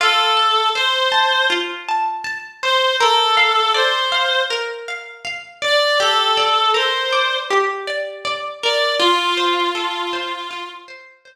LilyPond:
<<
  \new Staff \with { instrumentName = "Clarinet" } { \time 4/4 \key f \major \tempo 4 = 80 a'4 c''4 r4. c''8 | a'4 c''4 r4. d''8 | a'4 c''4 r4. d''8 | f'2~ f'8 r4. | }
  \new Staff \with { instrumentName = "Pizzicato Strings" } { \time 4/4 \key f \major f'8 a''8 c''8 a''8 f'8 a''8 a''8 c''8 | bes'8 f''8 d''8 f''8 bes'8 f''8 f''8 d''8 | g'8 d''8 bes'8 d''8 g'8 d''8 d''8 bes'8 | f'8 c''8 a'8 c''8 f'8 c''8 c''8 r8 | }
>>